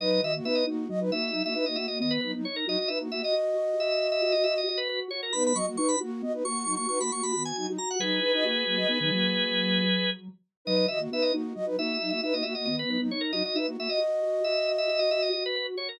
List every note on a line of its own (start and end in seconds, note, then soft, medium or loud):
0.00 0.20 F#3 medium
0.00 0.21 D#4 loud
0.00 0.21 B4 loud
0.00 0.10 D#5 loud
0.10 0.21 D#5 loud
0.22 0.40 D#3 medium
0.22 0.32 F#4 medium
0.22 0.32 D#5 medium
0.22 0.35 E5 medium
0.35 0.46 A#3 medium
0.35 0.46 F#4 medium
0.44 0.64 B3 medium
0.44 0.64 D#4 medium
0.44 0.64 B4 loud
0.44 0.56 E5 medium
0.55 0.66 D#5 medium
0.66 0.88 A#3 medium
0.66 0.85 D#4 medium
0.66 0.88 F#4 medium
0.89 1.10 F#3 medium
0.89 1.00 F#4 medium
0.89 1.00 D#5 medium
1.00 1.11 D#4 medium
1.00 1.11 B4 loud
1.11 1.31 A#3 medium
1.11 1.50 D#4 medium
1.11 1.31 F#4 loud
1.11 1.43 E5 loud
1.32 1.43 F#3 medium
1.32 1.43 D#4 loud
1.44 1.55 A#3 medium
1.44 1.55 F#4 medium
1.44 1.54 E5 loud
1.54 1.65 D#4 medium
1.54 1.66 D#4 medium
1.54 1.65 B4 loud
1.54 1.65 E5 medium
1.66 1.76 A#3 medium
1.66 1.77 D#4 medium
1.66 1.76 F#4 medium
1.66 1.76 D#5 medium
1.76 1.87 A#3 medium
1.76 1.87 F#4 medium
1.76 1.99 F#4 medium
1.76 1.86 E5 medium
1.88 2.00 A#3 medium
1.88 2.00 F#4 medium
1.88 1.98 D#5 medium
1.99 2.18 D#3 medium
1.99 2.41 B3 medium
1.99 2.18 B3 loud
1.99 2.12 D#5 medium
2.11 2.20 B4 loud
2.21 2.34 F#3 medium
2.21 2.34 D#4 medium
2.21 2.32 B4 medium
2.35 2.45 F#3 medium
2.35 2.45 D#4 loud
2.44 2.65 D#4 medium
2.44 2.56 C#5 medium
2.56 2.67 A#4 medium
2.66 2.77 F#3 loud
2.66 2.77 D#4 loud
2.66 2.88 F#4 medium
2.66 2.78 D#5 loud
2.79 2.89 D#5 medium
2.88 2.99 D#4 medium
2.88 3.08 D#4 medium
2.88 2.99 B4 medium
2.88 2.99 E5 medium
3.00 3.11 A#3 medium
3.00 3.11 F#4 medium
3.11 3.22 A#3 medium
3.11 3.32 F#4 medium
3.11 3.21 F#4 medium
3.11 3.22 E5 medium
3.21 4.61 F#4 medium
3.21 4.61 D#5 medium
3.21 3.35 D#5 medium
3.33 3.54 F#4 medium
3.55 3.74 F#4 medium
3.78 4.21 F#4 medium
3.78 4.07 E5 medium
4.12 4.21 E5 loud
4.22 4.33 F#4 medium
4.22 4.32 E5 loud
4.32 4.44 F#4 medium
4.32 4.43 D#5 medium
4.44 4.64 F#4 medium
4.44 4.54 E5 loud
4.58 4.68 D#5 medium
4.67 5.08 F#4 medium
4.67 4.79 D#5 medium
4.78 4.88 B4 loud
4.89 5.00 B4 loud
5.11 5.30 F#4 medium
5.11 5.21 C#5 medium
5.23 5.33 A#4 medium
5.33 5.53 B3 medium
5.33 5.52 D#4 medium
5.33 5.52 B4 loud
5.33 5.43 B5 loud
5.47 5.57 B5 loud
5.55 5.77 F#3 medium
5.55 5.66 F#4 medium
5.55 5.66 D#5 medium
5.55 5.66 C#6 medium
5.67 5.77 A#3 medium
5.67 5.77 F#4 loud
5.77 5.96 D#4 medium
5.77 5.96 B4 medium
5.77 5.88 C#6 medium
5.89 5.99 B5 loud
6.00 6.22 A#3 medium
6.00 6.20 F#4 medium
6.00 6.22 F#4 loud
6.22 6.42 B3 medium
6.22 6.33 F#4 medium
6.22 6.33 D#5 medium
6.33 6.44 D#4 medium
6.33 6.44 B4 medium
6.44 6.65 A#3 medium
6.44 6.86 F#4 medium
6.44 6.65 F#4 medium
6.44 6.74 C#6 loud
6.65 6.76 F#3 medium
6.65 6.76 D#4 loud
6.76 6.87 A#3 medium
6.76 6.87 F#4 loud
6.76 6.87 C#6 medium
6.88 6.99 D#4 medium
6.88 6.99 F#4 medium
6.88 6.99 B4 medium
6.88 6.99 C#6 loud
7.00 7.10 A#3 medium
7.00 7.10 F#4 medium
7.00 7.11 F#4 medium
7.00 7.11 B5 medium
7.11 7.22 A#3 medium
7.11 7.32 F#4 medium
7.11 7.22 F#4 medium
7.11 7.23 C#6 medium
7.22 7.33 A#3 medium
7.22 7.33 F#4 medium
7.22 7.32 B5 medium
7.32 7.52 D#3 medium
7.32 7.52 B3 medium
7.32 7.70 F#4 medium
7.32 7.43 B5 medium
7.45 7.55 G#5 medium
7.56 7.67 F#3 medium
7.56 7.67 D#4 loud
7.56 7.66 G#5 medium
7.67 7.78 F#3 medium
7.67 7.78 D#4 medium
7.77 7.95 F#4 medium
7.77 7.89 A#5 medium
7.91 8.01 F#5 medium
7.99 8.17 F#3 medium
7.99 8.20 F#3 loud
7.99 8.20 D#4 loud
7.99 10.10 G#4 medium
7.99 10.10 B4 loud
8.21 8.32 D#4 medium
8.21 8.33 D#4 medium
8.21 8.32 B4 loud
8.34 8.44 D#4 medium
8.34 8.43 F#4 medium
8.34 8.45 D#5 medium
8.43 8.64 A#3 medium
8.43 8.64 F#4 medium
8.66 8.84 F#3 medium
8.66 8.78 A#3 medium
8.66 8.76 F#4 medium
8.77 8.87 F#4 medium
8.77 8.87 D#5 medium
8.88 8.99 B3 medium
8.88 8.99 D#4 medium
8.88 8.99 B4 medium
9.00 9.11 D#3 medium
9.00 9.11 F#3 medium
9.00 9.11 D#4 loud
9.11 10.28 F#3 medium
9.11 9.82 A#3 medium
9.11 9.82 F#4 medium
10.65 10.87 F#3 medium
10.65 10.86 D#4 loud
10.65 10.86 B4 loud
10.65 10.76 D#5 loud
10.76 10.87 D#5 loud
10.88 11.07 D#3 medium
10.88 10.99 F#4 medium
10.88 11.00 D#5 medium
10.88 10.99 E5 medium
10.99 11.10 A#3 medium
10.99 11.10 F#4 medium
11.11 11.31 B3 medium
11.11 11.32 D#4 medium
11.11 11.32 B4 loud
11.11 11.24 E5 medium
11.22 11.33 D#5 medium
11.33 11.53 A#3 medium
11.33 11.52 D#4 medium
11.33 11.53 F#4 medium
11.55 11.77 F#3 medium
11.55 11.65 F#4 medium
11.55 11.65 D#5 medium
11.66 11.76 D#4 medium
11.66 11.76 B4 loud
11.77 11.98 A#3 medium
11.77 12.17 D#4 medium
11.77 11.98 F#4 loud
11.77 12.10 E5 loud
12.01 12.12 F#3 medium
12.01 12.12 D#4 loud
12.10 12.21 A#3 medium
12.10 12.21 F#4 medium
12.10 12.21 E5 loud
12.22 12.33 D#4 medium
12.22 12.34 D#4 medium
12.22 12.34 B4 loud
12.22 12.34 E5 medium
12.33 12.43 A#3 medium
12.33 12.44 D#4 medium
12.33 12.43 F#4 medium
12.33 12.44 D#5 medium
12.43 12.55 A#3 medium
12.43 12.55 F#4 medium
12.43 12.65 F#4 medium
12.43 12.53 E5 medium
12.55 12.67 A#3 medium
12.55 12.67 F#4 medium
12.55 12.65 D#5 medium
12.65 12.84 D#3 medium
12.65 12.84 B3 loud
12.65 13.08 B3 medium
12.65 12.76 D#5 medium
12.79 12.90 B4 loud
12.87 12.98 F#3 medium
12.87 12.98 D#4 medium
12.87 13.01 B4 medium
13.01 13.11 F#3 medium
13.01 13.11 D#4 loud
13.11 13.32 D#4 medium
13.11 13.22 C#5 medium
13.21 13.31 A#4 medium
13.32 13.42 F#3 loud
13.32 13.42 D#4 loud
13.32 13.54 F#4 medium
13.32 13.43 D#5 loud
13.45 13.56 D#5 medium
13.55 13.74 D#4 medium
13.55 13.67 D#4 medium
13.55 13.67 B4 medium
13.55 13.66 E5 medium
13.67 13.77 A#3 medium
13.67 13.77 F#4 medium
13.77 13.88 A#3 medium
13.77 13.88 F#4 medium
13.77 13.98 F#4 medium
13.77 13.90 E5 medium
13.89 15.28 F#4 medium
13.89 15.28 D#5 medium
13.89 14.00 D#5 medium
14.00 14.20 F#4 medium
14.22 14.40 F#4 medium
14.44 14.88 F#4 medium
14.44 14.72 E5 medium
14.78 14.89 E5 loud
14.89 14.99 F#4 medium
14.89 15.00 E5 loud
14.99 15.10 F#4 medium
14.99 15.10 D#5 medium
15.11 15.29 F#4 medium
15.11 15.22 E5 loud
15.22 15.32 D#5 medium
15.33 15.75 F#4 medium
15.33 15.44 D#5 medium
15.46 15.55 B4 loud
15.56 15.67 B4 loud
15.77 15.96 F#4 medium
15.77 15.88 C#5 medium
15.89 15.99 A#4 medium